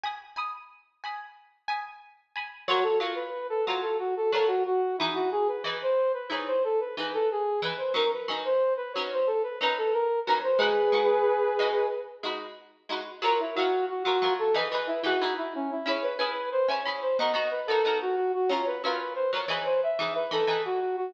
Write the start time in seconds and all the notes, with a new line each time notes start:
0.03 G#5 B5 D#6
0.36 G#5 B5 D#6
1.04 G#5 B5 D#6
1.68 G#5 B5 D#6
2.36 G#5 B5 D#6
2.68 F#3 F4 F#4 A#4 C#5
2.83 A4
3.00 F#3 F4 A#4 C#5
3.15 B4
3.50 A4
3.66 F#3 F4 F#4 A#4 C#5
3.82 A4
3.99 F#4
4.17 A4
4.32 F#3 F4 A4 A#4 C#5
4.48 F#4
4.66 F#4
4.98 E3 D#4 E4 G#4
5.03 B4
5.14 F#4
5.32 G#4
5.48 B4
5.64 E3 D#4 G#4 B4
5.82 C5
6.14 B4
6.30 E3 D#4 G#4 B4 C#5
6.47 C5
6.64 A4
6.80 B4
6.97 E3 D#4 G#4 B4
7.14 A4
7.31 G#4
7.62 E3 D#4 G#4 B4
7.77 C5
7.94 F#3 C#4 D#4 A#4
8.13 B4
8.28 F#3 C#4 D#4 A#4
8.45 C5
8.77 B4
8.93 F#3 C#4 C#5
8.98 D#4 A#4
9.12 C5
9.27 A4
9.43 B4
9.61 F#3 C#4 D#4 A#4 B4
9.78 A4
9.93 A#4
10.26 F#3 C#4 D#4 B4
10.30 A#4
10.43 C5
10.58 G#3 D#4 F#4 G#4 B4
10.92 G#3 D#4 F#4 B4
11.59 G#3 D#4 F#4 B4
12.23 G#3 D#4 F#4 B4
12.89 G#3 D#4 F#4 B4
13.22 F#3 F4 A#4 C#5
13.40 E4
13.55 F#3 F4 F#4 A#4
13.59 C#5
13.90 F#4
14.03 F#3 F4 F#4 A#4
14.08 C#5
14.22 F#3 F4 A#4 C#5
14.39 A4
14.54 E3 D#4 G#4 B4
14.72 E3 D#4 G#4 B4
14.87 E4
15.03 E3 D#4 F#4 G#4 B4
15.21 E3 D#4 G#4 B4
15.38 E4
15.55 C#4
15.71 E4
15.86 C#4 E4 G#4 B4 C#5
16.03 B4
16.18 C#4 E4 G#4 B4
16.52 C5
16.68 C#4 E4 G#4 B4 C#5
16.85 C#4 E4 G#4 B4
17.02 C5
17.19 B3 D#4 F#4 A#4 D#5
17.34 B3 D#4 F#4 A#4
17.51 B4
17.67 B3 D#4 F#4 A4
17.71 A#4
17.85 B3 D#4 F#4 A#4
18.02 F#4
18.16 F#4
18.34 F#4
18.49 F#3 C#4 F4 A#4 C#5
18.66 B4
18.84 F#3 C#4 F4 A#4 B4
19.15 C5
19.33 F#3 C#4 F4 A#4 C#5
19.48 E3 D#4 G#4 B4
19.65 C5
19.83 E5
19.99 E3 D#4 G#4 B4
20.15 B4
20.31 E3 D#4 G#4 A4 B4
20.47 E3 D#4 G#4 B4
20.65 F#4
20.80 F#4
20.97 F#4